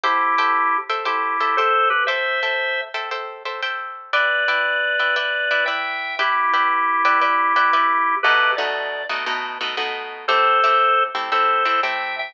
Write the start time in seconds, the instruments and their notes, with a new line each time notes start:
0.04 drawbar organ E4 G4, acoustic guitar (steel) A4 C5 E5 G5
0.38 acoustic guitar (steel) A4 C5 E5 G5
0.89 acoustic guitar (steel) A4 C5 E5 G5
1.05 drawbar organ E4 G4, acoustic guitar (steel) A4 C5 E5 G5
1.40 acoustic guitar (steel) A4 C5 E5 G5
1.57 drawbar organ A4 C5, acoustic guitar (steel) A4 C5 E5 G5
1.90 drawbar organ G4 B4
2.07 acoustic guitar (steel) A4 C5 E5 G5, drawbar organ C5 E5
2.43 acoustic guitar (steel) A4 C5 E5 G5
2.94 acoustic guitar (steel) A4 C5 E5 G5
3.11 acoustic guitar (steel) A4 C5 E5 G5
3.45 acoustic guitar (steel) A4 C5 E5 G5
3.63 acoustic guitar (steel) A4 C5 E5 G5
4.13 acoustic guitar (steel) E4 B4 D5 G5, drawbar organ B4 D5
4.48 acoustic guitar (steel) E4 B4 D5 G5
4.99 acoustic guitar (steel) E4 B4 D5 G5
5.16 acoustic guitar (steel) E4 B4 D5 G5
5.51 acoustic guitar (steel) E4 B4 D5 G5
5.66 acoustic guitar (steel) E4 B4 D5 G5, drawbar organ E5 G5
6.19 acoustic guitar (steel) E4 B4 D5 G5, drawbar organ E4 G4
6.53 acoustic guitar (steel) E4 B4 D5 G5
7.05 acoustic guitar (steel) E4 B4 D5 G5
7.21 acoustic guitar (steel) E4 B4 D5 G5
7.56 acoustic guitar (steel) E4 B4 D5 G5
7.73 acoustic guitar (steel) E4 B4 D5 G5
8.23 acoustic guitar (steel) B2 A3 D#4 F#4, drawbar organ G4 B4
8.57 acoustic guitar (steel) B2 A3 D#4 F#4, drawbar organ D5
9.09 acoustic guitar (steel) B2 A3 D#4 F#4
9.26 acoustic guitar (steel) B2 A3 D#4 F#4
9.61 acoustic guitar (steel) B2 A3 D#4 F#4
9.77 acoustic guitar (steel) B2 A3 D#4 F#4
10.28 acoustic guitar (steel) A3 C4 E4 G4, drawbar organ A4 C5
10.64 acoustic guitar (steel) A3 C4 E4 G4
11.15 acoustic guitar (steel) A3 C4 E4 G4
11.32 acoustic guitar (steel) A3 C4 E4 G4, drawbar organ A4 C5
11.65 acoustic guitar (steel) A3 C4 E4 G4
11.83 acoustic guitar (steel) A3 C4 E4 G4, drawbar organ E5 G5
12.19 drawbar organ E5 G5